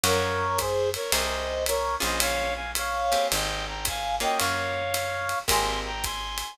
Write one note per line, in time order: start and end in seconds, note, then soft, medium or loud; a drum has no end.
0.04 0.97 F#2 loud
0.04 0.47 A#4 loud
0.04 0.60 A#4 medium
0.04 0.47 C#5 loud
0.04 0.60 C#5 medium
0.04 0.47 F5 loud
0.04 0.47 F#5 loud
0.04 ride loud
0.58 0.90 G#4 medium
0.58 0.90 C5 medium
0.58 kick medium
0.58 hi-hat pedal loud
0.58 ride medium
0.94 1.11 A#4 medium
0.94 1.11 C#5 medium
0.94 ride medium
1.11 1.97 C2 loud
1.11 1.55 G#4 loud
1.11 1.55 A#4 loud
1.11 1.64 C5 medium
1.11 1.55 C5 loud
1.11 1.64 D#5 medium
1.11 1.55 G5 loud
1.11 ride loud
1.66 1.96 A#4 medium
1.66 1.96 C#5 medium
1.66 hi-hat pedal loud
1.66 ride loud
2.00 3.16 A#1 loud
2.00 2.63 A#3 loud
2.00 2.63 C#4 loud
2.00 2.63 F4 loud
2.00 2.63 G#4 loud
2.00 2.21 C5 medium
2.00 2.21 D#5 medium
2.00 ride medium
2.20 2.54 C#5 medium
2.20 2.54 F5 medium
2.20 ride loud
2.55 2.71 F5 medium
2.55 2.71 G#5 medium
2.75 3.27 C#5 medium
2.75 3.27 F5 medium
2.75 hi-hat pedal medium
2.75 ride loud
3.12 3.74 A#3 medium
3.12 3.74 C4 loud
3.12 3.74 G4 loud
3.12 3.74 G#4 loud
3.12 ride medium
3.32 4.25 G#1 loud
3.32 3.65 D#5 medium
3.32 3.65 G5 medium
3.32 ride loud
3.67 3.85 G5 soft
3.67 3.85 A#5 medium
3.85 4.16 F5 medium
3.85 4.16 G#5 medium
3.85 kick medium
3.85 hi-hat pedal loud
3.85 ride loud
4.20 4.83 A#3 loud
4.20 4.83 C#4 loud
4.20 4.83 F4 loud
4.20 4.83 F#4 loud
4.20 4.38 D#5 medium
4.20 4.38 G5 medium
4.20 ride medium
4.38 5.34 F#2 medium
4.38 5.39 C#5 medium
4.38 5.39 F5 medium
4.38 ride loud
4.94 hi-hat pedal medium
4.94 ride loud
5.29 ride medium
5.48 6.43 G#1 loud
5.48 5.91 G#3 loud
5.48 5.91 A#3 loud
5.48 5.91 C4 loud
5.48 5.91 G4 loud
5.48 5.79 G#5 medium
5.48 5.79 C6 medium
5.48 kick medium
5.48 ride loud
5.85 6.04 G5 medium
5.85 6.04 A#5 medium
6.03 6.54 G#5 medium
6.03 6.54 C6 medium
6.03 kick medium
6.03 hi-hat pedal medium
6.03 ride medium
6.38 ride medium